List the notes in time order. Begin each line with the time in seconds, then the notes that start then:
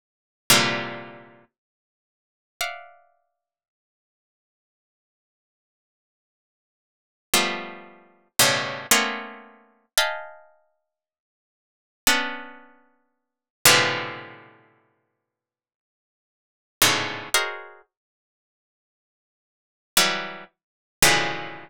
0.50 A#2 C3 D3 E3 F3 G3
2.61 D5 E5 F5 F#5
7.34 F3 G3 A3 B3
8.39 G2 A2 B2 C#3
8.91 A3 A#3 B3 C4 C#4
9.98 D#5 F5 G5 G#5 A5 B5
12.07 B3 C#4 D4
13.65 A2 B2 C3 D3 E3 F3
16.82 G#2 A2 B2 C#3 D3
17.34 F#4 G#4 A#4 C5 C#5 D#5
19.97 E3 F#3 G3
21.02 A2 B2 C#3 D3 E3 F3